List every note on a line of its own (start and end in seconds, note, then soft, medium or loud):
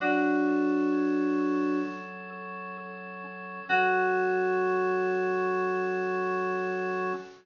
0.00 1.84 F#3 medium
0.00 1.78 D4 medium
0.00 1.78 F#4 medium
0.48 1.39 A4 medium
0.93 3.24 C#4 medium
1.39 2.30 A4 medium
1.85 3.60 F#3 medium
2.30 2.77 A4 medium
2.78 3.65 A4 medium
3.24 3.68 C#4 medium
3.69 7.13 F#3 loud
3.69 7.13 C#4 loud
3.69 7.13 F#4 loud
3.69 7.13 A4 medium